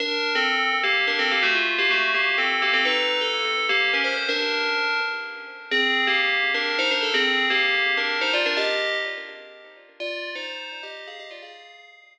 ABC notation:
X:1
M:3/4
L:1/16
Q:1/4=126
K:Cdor
V:1 name="Tubular Bells"
[DB]3 [CA]4 [B,G]2 [DB] [CA] [B,G] | [A,^F] =F2 [B,G] [A,^F]2 [B,G]2 [CA]2 [B,G] [CA] | [E_c]3 A4 [B,G]2 [_DB] =c c | [DB]6 z6 |
[K:Fdor] [CA]3 [B,G]4 [DB]2 [Ec] [DB] =A | [CA]3 [B,G]4 [DB]2 [Ec] [Fd] [DB] | [Ge]4 z8 | [Fd]3 [Ec]4 [Ge]2 [Af] [Ge] [Fd] |
[Af]6 z6 |]